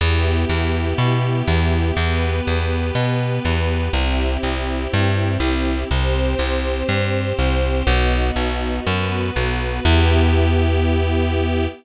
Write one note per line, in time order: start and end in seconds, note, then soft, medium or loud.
0.01 0.45 E2 medium
0.01 1.95 B3 medium
0.01 1.95 E4 medium
0.01 1.95 G4 medium
0.49 0.94 E2 medium
0.98 1.42 B2 medium
1.48 1.92 E2 medium
1.97 2.41 E2 medium
1.97 3.92 B3 medium
1.97 3.92 G4 medium
1.97 3.92 B4 medium
2.47 2.91 E2 medium
2.95 3.39 B2 medium
3.45 3.89 E2 medium
3.93 4.37 C2 medium
3.93 5.88 C4 medium
3.93 5.88 E4 medium
3.93 5.88 G4 medium
4.43 4.87 C2 medium
4.93 5.38 G2 medium
5.40 5.84 C2 medium
5.90 6.35 C2 medium
5.90 7.85 C4 medium
5.90 7.85 G4 medium
5.90 7.85 C5 medium
6.39 6.83 C2 medium
6.89 7.33 G2 medium
7.39 7.83 C2 medium
7.87 8.31 B1 loud
7.87 8.85 B3 medium
7.87 8.85 D#4 medium
7.87 8.85 F#4 medium
8.36 8.80 B1 medium
8.86 9.31 F#2 medium
8.86 9.82 B3 medium
8.86 9.84 F#4 medium
8.86 9.84 B4 medium
9.36 9.80 B1 medium
9.83 11.67 E2 loud
9.83 11.65 B3 loud
9.83 11.65 E4 medium
9.83 11.65 G4 loud